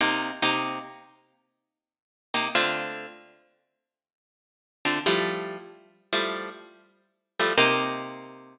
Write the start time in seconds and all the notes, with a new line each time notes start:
0.01 C3 A#3 D#4 G4
0.42 C3 A#3 D#4 G4
2.34 C3 A#3 D#4 G4
2.55 D3 A3 C4 F4
4.85 D3 A3 C4 F4
5.06 F3 G3 A3 E4
6.13 F3 G3 A3 E4
7.39 F3 G3 A3 E4
7.58 C3 A#3 D#4 G4